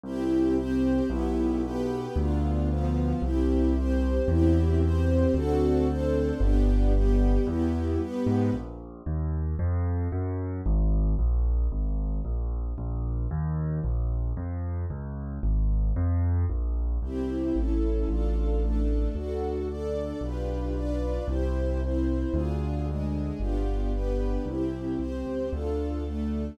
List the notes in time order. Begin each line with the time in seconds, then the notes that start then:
0.04 C2 C4 E4 G4
0.56 C4 G4 C5
1.09 B1 B3 E4 G4
1.63 B3 G4 B4
2.16 D2 B3 D4 F4
2.69 F3 B3 F4
3.22 C2 C4 E4 G4
3.75 C4 G4 C5
4.28 E2 C4 E4 G4
4.82 C4 G4 C5
5.34 D2 C4 D4 F#4 A4
5.88 C4 D4 A4 C5
6.40 G1 B3 D4 G4
6.94 G3 B3 G4
7.47 E2 B3 E4 G4
8.00 G2 B3 G4 B4
8.27 G#2
8.53 A#1
9.06 D#2
9.59 F2
10.12 F#2
10.66 G#1
11.19 A#1
11.72 G#1
12.25 A#1
12.78 A#1
13.31 D#2
13.84 A#1
14.37 F2
14.90 C#2
15.43 G#1
15.96 F2
16.50 A#1
17.02 C2 C4 E4 G4
17.56 A1 C#4 E4 A4
18.08 A1 D4 F4 A4
18.62 A3 D4 A4
19.15 D2 D4 F#4 A4
19.69 D4 A4 D5
20.21 B1 D4 F4 G4 B4
20.75 D4 F4 B4 D5
21.28 C2 E4 G4 C5
21.82 C4 E4 C5
22.33 D2 D4 F4 G#4
22.87 G#3 D4 G#4
23.39 G1 B3 D4 F4 G4
23.93 B3 D4 G4 B4
24.46 C2 C4 E4 G4
24.98 C2 C4 G4 C5
25.26 C#2
25.51 D2 D4 F4 A4
26.04 A3 D4 A4